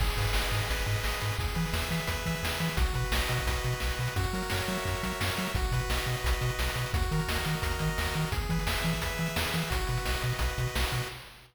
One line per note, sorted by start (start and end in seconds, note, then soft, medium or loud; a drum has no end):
0.00 0.10 G#1 loud
0.00 0.52 G#4 loud
0.00 kick loud
0.00 crash loud
0.07 closed hi-hat medium
0.17 0.27 G#2 medium
0.17 0.69 B4 medium
0.17 kick medium
0.17 closed hi-hat medium
0.24 closed hi-hat medium
0.33 0.44 G#1 medium
0.33 0.86 D#5 medium
0.33 snare loud
0.42 closed hi-hat medium
0.52 0.61 G#2 medium
0.52 1.04 G#4 medium
0.52 closed hi-hat medium
0.62 closed hi-hat medium
0.69 0.79 G#1 medium
0.69 1.20 B4 medium
0.69 kick medium
0.69 closed hi-hat loud
0.79 closed hi-hat medium
0.86 0.96 G#2 medium
0.86 1.35 D#5 medium
0.86 closed hi-hat medium
0.96 closed hi-hat medium
1.04 1.14 G#1 medium
1.04 1.38 G#4 medium
1.04 snare loud
1.12 closed hi-hat medium
1.20 1.32 G#2 medium
1.20 1.37 B4 medium
1.20 closed hi-hat medium
1.32 closed hi-hat medium
1.39 1.48 E2 loud
1.39 1.89 G#4 medium
1.39 kick loud
1.39 closed hi-hat medium
1.48 closed hi-hat medium
1.55 1.66 E3 loud
1.55 2.07 B4 medium
1.55 closed hi-hat medium
1.65 closed hi-hat medium
1.73 1.83 E2 loud
1.73 2.26 E5 medium
1.73 snare loud
1.81 closed hi-hat medium
1.90 2.00 E3 medium
1.90 2.43 G#4 medium
1.90 closed hi-hat medium
2.00 closed hi-hat medium
2.07 2.18 E2 medium
2.07 2.60 B4 medium
2.07 kick medium
2.07 closed hi-hat loud
2.16 closed hi-hat medium
2.26 2.35 E3 medium
2.26 2.76 E5 medium
2.26 kick medium
2.26 closed hi-hat medium
2.35 closed hi-hat medium
2.43 2.52 E2 medium
2.43 2.76 G#4 medium
2.43 snare loud
2.52 closed hi-hat medium
2.59 2.70 E3 medium
2.59 2.77 B4 medium
2.59 closed hi-hat medium
2.68 closed hi-hat medium
2.77 2.87 B1 loud
2.77 3.29 F#4 medium
2.77 kick loud
2.77 closed hi-hat loud
2.86 closed hi-hat medium
2.93 3.04 B2 medium
2.93 3.46 B4 medium
2.93 kick medium
2.93 closed hi-hat medium
3.04 closed hi-hat medium
3.12 3.21 B1 medium
3.12 3.64 D#5 medium
3.12 snare loud
3.28 3.39 B2 medium
3.28 3.81 F#4 medium
3.28 closed hi-hat medium
3.38 kick medium
3.38 closed hi-hat medium
3.47 3.56 B1 loud
3.47 4.00 B4 medium
3.47 kick medium
3.47 closed hi-hat loud
3.56 closed hi-hat medium
3.64 3.74 B2 medium
3.64 4.14 D#5 medium
3.64 closed hi-hat medium
3.72 closed hi-hat medium
3.80 3.91 B1 medium
3.80 4.14 F#4 medium
3.80 snare loud
3.90 closed hi-hat medium
3.99 4.08 B2 medium
3.99 4.17 B4 medium
3.99 closed hi-hat medium
4.07 closed hi-hat medium
4.16 4.26 F#2 loud
4.16 4.84 F#4 loud
4.16 kick loud
4.16 closed hi-hat loud
4.24 closed hi-hat medium
4.33 4.43 F#3 medium
4.33 5.03 A#4 medium
4.33 closed hi-hat medium
4.42 closed hi-hat medium
4.50 4.61 F#2 medium
4.50 5.20 C#5 medium
4.50 snare loud
4.60 closed hi-hat medium
4.68 4.78 F#3 medium
4.68 5.38 E5 medium
4.68 closed hi-hat medium
4.77 closed hi-hat medium
4.85 4.95 F#2 medium
4.85 5.51 F#4 medium
4.85 kick medium
4.85 closed hi-hat medium
4.95 closed hi-hat medium
5.03 5.13 F#3 medium
5.03 5.53 A#4 medium
5.03 kick medium
5.03 closed hi-hat medium
5.11 closed hi-hat medium
5.20 5.30 F#2 medium
5.20 5.53 C#5 medium
5.20 snare loud
5.28 closed hi-hat medium
5.37 5.48 F#3 medium
5.37 5.55 E5 medium
5.37 closed hi-hat medium
5.47 closed hi-hat medium
5.54 5.64 B1 loud
5.54 6.07 F#4 loud
5.54 kick loud
5.54 closed hi-hat medium
5.64 closed hi-hat medium
5.72 5.81 B2 medium
5.72 6.23 B4 medium
5.72 kick medium
5.72 closed hi-hat medium
5.80 closed hi-hat medium
5.89 5.98 B1 medium
5.89 6.41 D#5 medium
5.89 snare loud
5.97 closed hi-hat medium
6.06 6.16 B2 medium
6.06 6.59 F#4 medium
6.06 closed hi-hat medium
6.16 closed hi-hat medium
6.24 6.34 B1 medium
6.24 6.76 B4 medium
6.24 kick medium
6.24 closed hi-hat loud
6.33 closed hi-hat medium
6.41 6.51 B2 medium
6.41 6.91 D#5 medium
6.41 closed hi-hat medium
6.49 closed hi-hat medium
6.59 6.68 B1 medium
6.59 6.92 F#4 medium
6.59 snare loud
6.69 closed hi-hat medium
6.75 6.85 B2 medium
6.75 6.93 B4 medium
6.75 closed hi-hat medium
6.86 closed hi-hat medium
6.93 7.03 D#2 loud
6.93 7.46 F#4 medium
6.93 kick loud
6.93 closed hi-hat loud
7.02 closed hi-hat medium
7.11 7.21 D#3 loud
7.11 7.61 A#4 medium
7.11 closed hi-hat medium
7.19 closed hi-hat medium
7.28 7.38 D#2 medium
7.28 7.80 D#5 medium
7.28 snare loud
7.36 closed hi-hat medium
7.45 7.55 D#3 medium
7.45 7.98 F#4 medium
7.45 closed hi-hat medium
7.53 closed hi-hat medium
7.62 7.73 D#2 medium
7.62 8.15 A#4 medium
7.62 kick medium
7.62 closed hi-hat loud
7.71 closed hi-hat medium
7.79 7.90 D#3 medium
7.79 8.30 D#5 medium
7.79 kick medium
7.79 closed hi-hat medium
7.88 closed hi-hat medium
7.98 8.08 D#2 medium
7.98 8.32 F#4 medium
7.98 snare loud
8.05 closed hi-hat medium
8.14 8.25 D#3 medium
8.14 8.32 A#4 medium
8.14 closed hi-hat medium
8.25 closed hi-hat medium
8.32 8.42 E2 loud
8.32 8.84 G#4 medium
8.32 kick loud
8.32 closed hi-hat loud
8.41 closed hi-hat medium
8.49 8.59 E3 loud
8.49 9.02 B4 medium
8.49 kick medium
8.49 closed hi-hat medium
8.59 closed hi-hat medium
8.67 8.76 E2 medium
8.67 9.20 E5 medium
8.67 snare loud
8.77 closed hi-hat medium
8.84 8.94 E3 loud
8.84 9.36 G#4 medium
8.84 closed hi-hat medium
8.92 kick medium
8.92 closed hi-hat medium
9.01 9.11 E2 medium
9.01 9.53 B4 medium
9.01 kick medium
9.01 closed hi-hat loud
9.10 closed hi-hat medium
9.18 9.28 E3 medium
9.18 9.69 E5 medium
9.18 closed hi-hat medium
9.26 closed hi-hat medium
9.36 9.46 E2 medium
9.36 9.69 G#4 medium
9.36 snare loud
9.45 closed hi-hat medium
9.53 9.63 E3 medium
9.53 9.70 B4 medium
9.53 closed hi-hat medium
9.62 closed hi-hat medium
9.70 9.80 B1 loud
9.70 10.23 F#4 loud
9.70 kick loud
9.70 closed hi-hat loud
9.79 closed hi-hat medium
9.87 9.98 B2 medium
9.87 10.41 B4 medium
9.87 closed hi-hat medium
9.97 closed hi-hat medium
10.05 10.16 B1 medium
10.05 10.58 D#5 medium
10.05 snare loud
10.14 closed hi-hat medium
10.22 10.33 B2 loud
10.22 10.75 F#4 medium
10.22 closed hi-hat medium
10.32 closed hi-hat medium
10.39 10.49 B1 medium
10.39 10.91 B4 medium
10.39 kick medium
10.39 closed hi-hat loud
10.49 closed hi-hat medium
10.58 10.67 B2 medium
10.58 11.08 D#5 medium
10.58 kick medium
10.58 closed hi-hat medium
10.67 closed hi-hat medium
10.76 10.85 B1 medium
10.76 11.09 F#4 medium
10.76 snare loud
10.84 closed hi-hat medium
10.92 11.02 B2 medium
10.92 11.08 B4 medium
10.92 closed hi-hat medium
11.02 closed hi-hat medium